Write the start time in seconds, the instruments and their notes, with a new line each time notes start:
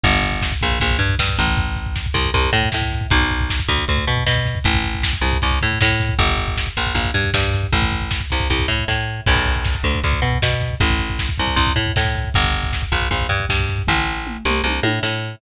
0.04 electric bass (finger) G1, kick, closed hi-hat
0.14 kick
0.23 kick, closed hi-hat
0.32 kick
0.42 kick, snare
0.52 kick
0.61 electric bass (finger) A#1, kick, closed hi-hat
0.71 kick
0.80 electric bass (finger) A#1, kick, closed hi-hat
0.91 kick
0.99 electric bass (finger) G2, kick, closed hi-hat
1.09 kick
1.19 electric bass (finger) G2, kick, snare
1.29 kick
1.37 electric bass (finger) A1, kick, snare, closed hi-hat
1.48 kick
1.57 kick, closed hi-hat
1.68 kick
1.76 kick, closed hi-hat
1.86 kick
1.96 kick, snare
2.06 kick
2.14 electric bass (finger) C2, kick, closed hi-hat
2.25 kick
2.34 electric bass (finger) C2, kick, closed hi-hat
2.44 kick
2.53 electric bass (finger) A2, kick, closed hi-hat
2.63 kick
2.72 electric bass (finger) A2, kick, snare
2.82 kick
2.92 kick, snare, closed hi-hat
3.01 kick
3.10 electric bass (finger) B1, kick, closed hi-hat
3.21 kick
3.30 kick, closed hi-hat
3.41 kick
3.50 kick, snare
3.59 kick
3.69 electric bass (finger) D2, kick, closed hi-hat
3.78 kick
3.88 electric bass (finger) D2, kick, closed hi-hat
3.98 kick
4.07 electric bass (finger) B2, kick, closed hi-hat
4.17 kick
4.27 electric bass (finger) B2, kick, snare
4.36 kick
4.46 kick, snare, closed hi-hat
4.55 kick
4.64 electric bass (finger) A1, kick, closed hi-hat
4.74 kick
4.84 kick, closed hi-hat
4.94 kick
5.03 kick, snare
5.13 kick
5.21 electric bass (finger) C2, kick, closed hi-hat
5.33 kick
5.42 electric bass (finger) C2, kick, closed hi-hat
5.51 kick
5.61 electric bass (finger) A2, kick, closed hi-hat
5.71 kick
5.81 electric bass (finger) A2, kick, snare
5.89 kick
6.00 kick, snare, closed hi-hat
6.09 kick
6.19 electric bass (finger) G1, kick, closed hi-hat
6.29 kick
6.38 kick, closed hi-hat
6.48 kick
6.57 kick, snare
6.67 kick
6.77 electric bass (finger) A#1, kick, closed hi-hat
6.86 kick
6.95 electric bass (finger) A#1, kick, closed hi-hat
7.05 kick
7.14 electric bass (finger) G2, kick, closed hi-hat
7.24 kick
7.34 electric bass (finger) G2, kick, snare
7.44 kick
7.54 kick, snare, closed hi-hat
7.63 kick
7.73 electric bass (finger) A1, kick, closed hi-hat
7.82 kick
7.92 kick, closed hi-hat
8.02 kick
8.11 kick, snare
8.21 kick
8.30 electric bass (finger) C2, kick, closed hi-hat
8.40 kick
8.50 electric bass (finger) C2, kick, closed hi-hat
8.60 kick
8.68 electric bass (finger) A2, kick, closed hi-hat
8.78 kick
8.88 electric bass (finger) A2, kick, snare
9.26 electric bass (finger) B1, kick, crash
9.36 kick
9.46 kick, closed hi-hat
9.56 kick
9.65 kick, snare
9.75 kick
9.83 electric bass (finger) D2, kick, closed hi-hat
9.95 kick
10.04 electric bass (finger) D2, kick, closed hi-hat
10.13 kick
10.22 electric bass (finger) B2, kick, closed hi-hat
10.33 kick
10.42 electric bass (finger) B2, kick, snare
10.52 kick
10.60 kick, snare, closed hi-hat
10.71 kick
10.80 electric bass (finger) A1, kick, closed hi-hat
10.90 kick
10.99 kick, closed hi-hat
11.10 kick
11.19 kick, snare
11.29 kick
11.38 electric bass (finger) C2, kick, closed hi-hat
11.47 kick
11.56 electric bass (finger) C2, kick, closed hi-hat
11.67 kick
11.76 electric bass (finger) A2, kick, closed hi-hat
11.86 kick
11.96 electric bass (finger) A2, kick, snare
12.05 kick
12.15 kick, snare, closed hi-hat
12.25 kick
12.34 electric bass (finger) G1, kick, closed hi-hat
12.44 kick
12.53 kick, closed hi-hat
12.63 kick
12.73 kick, snare
12.82 kick
12.92 electric bass (finger) A#1, kick, closed hi-hat
13.02 kick
13.11 electric bass (finger) A#1, kick, closed hi-hat
13.21 kick
13.29 electric bass (finger) G2, kick, closed hi-hat
13.40 kick
13.49 electric bass (finger) G2, kick, snare
13.59 kick
13.69 kick, snare, closed hi-hat
13.78 kick
13.87 electric bass (finger) A1, kick, floor tom
14.27 mid tom
14.45 electric bass (finger) C2, mid tom
14.64 electric bass (finger) C2, high tom
14.83 electric bass (finger) A2, high tom
15.03 electric bass (finger) A2, snare